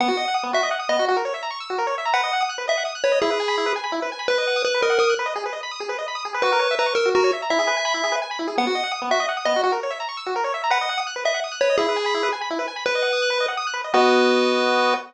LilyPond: <<
  \new Staff \with { instrumentName = "Lead 1 (square)" } { \time 3/4 \key b \major \tempo 4 = 168 fis''4 r8 e''8 r8 dis''8 | r2. | fis''4 r8 e''8 r8 cis''8 | gis'4. r4. |
b'4 b'8 ais'8 ais'8 r8 | r2. | b'4 b'8 ais'8 fis'8 r8 | e''2 r4 |
fis''4 r8 e''8 r8 dis''8 | r2. | fis''4 r8 e''8 r8 cis''8 | gis'4. r4. |
b'2 r4 | b'2. | }
  \new Staff \with { instrumentName = "Lead 1 (square)" } { \time 3/4 \key b \major b16 fis'16 dis''16 fis''16 dis'''16 b16 fis'16 dis''16 fis''16 dis'''16 b16 fis'16 | fis'16 ais'16 cis''16 e''16 ais''16 cis'''16 e'''16 fis'16 ais'16 cis''16 e''16 ais''16 | b'16 dis''16 fis''16 dis'''16 fis'''16 b'16 dis''16 fis''16 dis'''16 fis'''16 b'16 dis''16 | e'16 b'16 gis''16 b''16 e'16 b'16 gis''16 b''16 e'16 b'16 gis''16 b''16 |
b'16 dis''16 fis''16 dis'''16 fis'''16 b'16 dis''16 fis''16 dis'''16 fis'''16 b'16 dis''16 | gis'16 b'16 dis''16 b''16 dis'''16 gis'16 b'16 dis''16 b''16 dis'''16 gis'16 b'16 | fis'16 ais'16 cis''16 e''16 ais''16 cis'''16 e'''16 fis'16 ais'16 cis''16 e''16 ais''16 | e'16 gis'16 b'16 gis''16 b''16 e'16 gis'16 b'16 gis''16 b''16 e'16 gis'16 |
b16 fis'16 dis''16 fis''16 dis'''16 b16 fis'16 dis''16 fis''16 dis'''16 b16 fis'16 | fis'16 ais'16 cis''16 e''16 ais''16 cis'''16 e'''16 fis'16 ais'16 cis''16 e''16 ais''16 | b'16 dis''16 fis''16 dis'''16 fis'''16 b'16 dis''16 fis''16 dis'''16 fis'''16 b'16 dis''16 | e'16 b'16 gis''16 b''16 e'16 b'16 gis''16 b''16 e'16 b'16 gis''16 b''16 |
b'16 dis''16 fis''16 dis'''16 fis'''16 b'16 dis''16 fis''16 dis'''16 fis'''16 b'16 dis''16 | <b fis' dis''>2. | }
>>